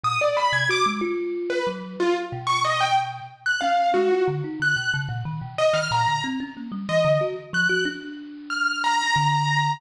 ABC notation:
X:1
M:6/8
L:1/16
Q:3/8=61
K:none
V:1 name="Acoustic Grand Piano"
^d' =d b ^g' =d' z4 B z2 | F z2 ^c' ^d g z3 ^f' =f2 | ^F2 z2 ^f'2 z4 ^d =f' | ^a2 z4 ^d2 z2 ^f'2 |
z4 f'2 ^a6 |]
V:2 name="Kalimba"
^A,, z2 C, ^F ^G, =F4 ^F,2 | z2 B,,6 z2 ^C2 | ^G, F D, ^D =D, B,, ^C, ^A,, ^D, B,, z D, | ^A,, D, C ^C ^A, G, E, D, ^F z =F, ^F |
D8 D,4 |]